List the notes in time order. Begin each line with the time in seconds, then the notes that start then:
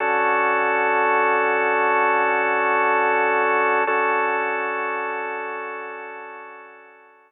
0.00 D3 C#4 F#4 A4
3.87 D3 C#4 F#4 A4